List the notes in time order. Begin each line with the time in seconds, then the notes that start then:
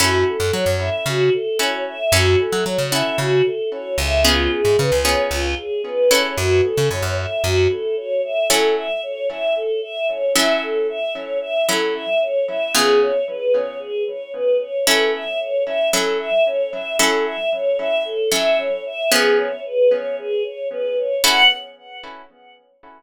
0.00 F#2 C#4 E4 F#4 A4
0.28 A4
0.40 F#2
0.53 F#3 C#5
0.66 F#2
0.80 E5
1.06 C#3 F#4
1.33 A4
1.59 C#4 E4 F#4 A4 C#5
1.87 E5
2.12 F#2 C#4 E4 F#4 A4
2.39 A4
2.52 F#3
2.65 F#3 C#5
2.78 C#3
2.91 C#4 E4 F#4 A4 E5
3.18 C#3 F#4
3.44 A4
3.71 C#5
3.98 C#2 E5
4.24 B3 C#4 F4 G#4
4.51 G#4
4.65 G#2
4.78 C#3 B4
4.92 C#2
5.05 B3 C#4 F4 G#4 C#5
5.30 C#2 F4
5.57 G#4
5.84 B4
6.11 C#4 E4 F#4 A4 C#5
6.36 F#2 F#4
6.63 A4
6.77 C#3
6.90 F#2 C#5
7.02 F#2
7.17 E5
7.43 F#2 F#4
7.70 A4
7.97 C#5
8.24 E5
8.50 F#3 C#4 E4 A4
8.76 E5
9.03 C#5
9.30 E5
9.56 A4
9.82 E5
10.09 C#5
10.36 F#3 C#4 E4 A4 E5
10.62 A4
10.89 E5
11.14 C#5
11.41 E5
11.69 F#3 C#4 E4 A4
11.95 E5
12.21 C#5
12.48 E5
12.74 C#3 B3 F4 G#4
13.02 C#5
13.27 B4
13.54 C#5
13.79 G#4
14.07 C#5
14.33 B4
14.60 C#5
14.86 F#3 C#4 E4 A4
15.14 E5
15.39 C#5
15.66 E5
15.93 F#3 C#4 E4 A4
16.20 E5
16.46 C#5
16.72 E5
16.99 F#3 C#4 E4 A4
17.26 E5
17.52 C#5
17.79 E5
18.05 A4
18.32 F#3 C#4 E4 A4 E5
18.58 C#5
18.86 E5
19.12 F3 B3 C#4 G#4
19.38 C#5
19.65 B4
19.91 C#5
20.19 G#4
20.44 C#5
20.71 B4
20.98 C#5
21.24 C#4 E4 F#4 A4 F#5